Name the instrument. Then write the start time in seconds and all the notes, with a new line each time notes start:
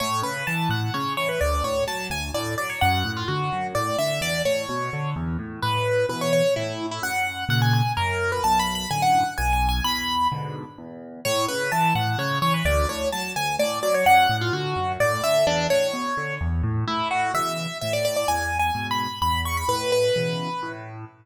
acoustic grand piano
0.00 A2 C#5
0.22 C#3 B4
0.47 E3 A5
0.69 A2 F#5
0.94 C#3 C#5
1.17 E3 C#5
1.29 B4
1.41 D2 D5
1.64 A2 C#5
1.87 F#3 A5
2.10 D2 G#5
2.34 A2 D5
2.58 F#3 D5
2.70 C#5
2.81 F#2 F#5
3.05 A2
3.17 F4
3.28 D3 F#4
3.52 F#2
3.75 A2 D5
3.98 D3 E5
4.21 E2 D5
4.45 A2 C#5
4.69 B2
4.93 D3
5.16 E2
5.39 A2
5.62 A2 B4
6.09 B2 E3 B4
6.21 C#5
6.33 C#5
6.56 A2 E4
6.91 E4
7.02 F#2 F#5
7.49 A#2 C#3 F#5
7.62 G#5
7.73 G#5
7.97 F#2 A#4
8.32 B4
8.44 B1 A5
8.59 B5
8.75 B5
8.91 F#2 A2 D3 G#5
9.02 F#5
9.38 B1 G#5
9.53 G#5
9.69 G#5
9.84 E2 B5
10.32 G#2 B2 D3
10.78 E2
11.25 A2 C#5
11.48 C#3 B4
11.72 E3 A5
11.95 A2 F#5
12.18 C#3 C#5
12.42 E3 C#5
12.54 B4
12.65 D2 D5
12.89 A2 C#5
13.12 F#3 A5
13.36 D2 G#5
13.59 A2 D5
13.83 F#3 D5
13.94 C#5
14.06 F#2 F#5
14.29 A2
14.41 F4
14.53 D3 F#4
14.76 F#2
15.00 A2 D5
15.23 D3 E5
15.47 E2 D4
15.70 A2 C#5
15.93 B2
16.17 D3
16.41 E2
16.63 A2
16.88 A2 E4
17.11 F#4
17.34 B2 C#3 E3 E5
17.81 A2 E5
17.93 D5
18.05 D5
18.16 D5
18.28 E2 G#5
18.59 G#5
18.75 G#2 B2
18.91 B5
19.22 E2 B5
19.45 C#6
19.57 B5
19.68 A2 B4
19.92 B4
20.16 B2 C#3 E3
20.63 A2